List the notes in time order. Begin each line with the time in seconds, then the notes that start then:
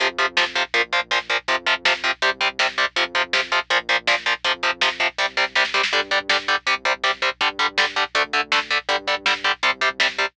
0.00 F2 C3 F3, kick, closed hi-hat
0.09 kick
0.18 C3 F3, kick, closed hi-hat
0.28 kick
0.37 C3 F3, kick, snare
0.46 kick
0.55 C3 F3, kick, closed hi-hat
0.65 kick
0.74 A#1 A#2 F3, kick, closed hi-hat
0.83 kick
0.93 A#2 F3, kick, closed hi-hat
1.02 kick
1.11 A#2 F3, kick, snare
1.20 kick
1.30 A#2 F3, kick, closed hi-hat
1.39 kick
1.48 F2 C3 F3, kick, closed hi-hat
1.57 kick
1.66 C3 F3, kick, closed hi-hat
1.76 kick
1.85 C3 F3, kick, snare
1.94 kick
2.04 C3 F3, kick, closed hi-hat
2.13 kick
2.22 C2 C3 G3, kick, closed hi-hat
2.32 kick
2.41 C3 G3, kick, closed hi-hat
2.50 kick
2.59 C3 G3, kick, snare
2.69 kick
2.78 C3 G3, kick, closed hi-hat
2.87 kick
2.96 F2 C3 F3, kick, closed hi-hat
3.05 kick
3.15 C3 F3, kick, closed hi-hat
3.24 kick
3.33 C3 F3, kick, snare
3.43 kick
3.52 C3 F3, kick, closed hi-hat
3.61 kick
3.70 A#1 A#2 F3, kick, closed hi-hat
3.80 kick
3.89 A#2 F3, kick, closed hi-hat
3.98 kick
4.07 A#2 F3, kick, snare
4.17 kick
4.26 A#2 F3, kick, closed hi-hat
4.35 kick
4.44 F2 C3 F3, kick, closed hi-hat
4.54 kick
4.63 C3 F3, kick, closed hi-hat
4.72 kick
4.81 C3 F3, kick, snare
4.91 kick
5.00 C3 F3, kick, closed hi-hat
5.09 kick
5.18 C2 C3 G3, kick, snare
5.37 C3 G3, snare
5.55 C3 G3, snare
5.65 snare
5.74 C3 G3, snare
5.83 snare
5.93 G2 D3 G3, kick, closed hi-hat
6.02 kick
6.11 D3 G3, kick, closed hi-hat
6.21 kick
6.29 D3 G3, kick, snare
6.39 kick
6.48 D3 G3, kick, closed hi-hat
6.57 kick
6.67 C2 C3 G3, kick, closed hi-hat
6.76 kick
6.85 C3 G3, kick, closed hi-hat
6.94 kick
7.04 C3 G3, kick, snare
7.13 kick
7.22 C3 G3, kick, closed hi-hat
7.32 kick
7.41 G2 D3 G3, kick, closed hi-hat
7.50 kick
7.59 D3 G3, kick, closed hi-hat
7.69 kick
7.78 D3 G3, kick, snare
7.87 kick
7.96 D3 G3, kick, closed hi-hat
8.05 kick
8.15 D2 D3 A3, kick, closed hi-hat
8.24 kick
8.33 D3 A3, kick, closed hi-hat
8.43 kick
8.52 D3 A3, kick, snare
8.61 kick
8.70 D3 A3, kick, closed hi-hat
8.79 kick
8.89 G2 D3 G3, kick, closed hi-hat
8.98 kick
9.07 D3 G3, kick, closed hi-hat
9.17 kick
9.26 D3 G3, kick, snare
9.35 kick
9.44 D3 G3, kick, closed hi-hat
9.54 kick
9.63 C2 C3 G3, kick, closed hi-hat
9.72 kick
9.81 C3 G3, kick, closed hi-hat
9.91 kick
10.00 C3 G3, kick, snare
10.09 kick
10.18 C3 G3, kick, closed hi-hat
10.28 kick